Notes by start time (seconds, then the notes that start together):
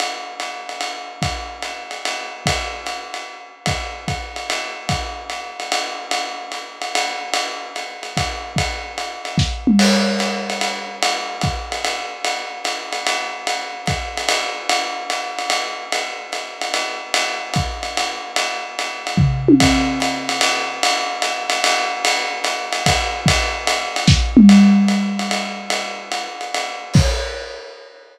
0.00 ride
0.40 hi-hat pedal, ride
0.69 ride
0.81 ride
1.22 kick, ride
1.62 hi-hat pedal, ride
1.91 ride
2.05 ride
2.46 kick, ride
2.86 hi-hat pedal, ride
3.14 ride
3.66 kick, ride
4.08 kick, hi-hat pedal, ride
4.36 ride
4.50 ride
4.89 kick, ride
5.30 hi-hat pedal, ride
5.60 ride
5.72 ride
6.11 ride
6.52 hi-hat pedal, ride
6.82 ride
6.95 ride
7.34 ride
7.76 hi-hat pedal, ride
8.03 ride
8.17 kick, ride
8.56 kick, ride
8.98 hi-hat pedal, ride
9.25 ride
9.38 kick, snare
9.67 mid tom
9.79 crash, ride
10.19 hi-hat pedal, ride
10.50 ride
10.61 ride
11.03 ride
11.41 kick, hi-hat pedal, ride
11.72 ride
11.85 ride
12.24 ride
12.64 hi-hat pedal, ride
12.93 ride
13.07 ride
13.47 ride
13.86 kick, hi-hat pedal, ride
14.17 ride
14.29 ride
14.69 ride
15.10 hi-hat pedal, ride
15.39 ride
15.50 ride
15.92 ride
16.32 hi-hat pedal, ride
16.61 ride
16.74 ride
17.14 ride
17.54 kick, hi-hat pedal, ride
17.83 ride
17.97 ride
18.36 ride
18.79 hi-hat pedal, ride
19.07 ride
19.17 kick, floor tom
19.48 high tom
19.60 kick, ride
20.00 hi-hat pedal, ride
20.29 ride
20.41 ride
20.83 ride
21.22 hi-hat pedal, ride
21.50 ride
21.64 ride
22.05 ride
22.44 hi-hat pedal, ride
22.73 ride
22.86 kick, ride
23.26 kick, ride
23.67 hi-hat pedal, ride
23.96 ride
24.07 kick, snare
24.37 mid tom
24.49 ride
24.88 hi-hat pedal, ride
25.19 ride
25.31 ride
25.70 ride
26.12 hi-hat pedal, ride
26.41 ride
26.54 ride
26.94 kick, crash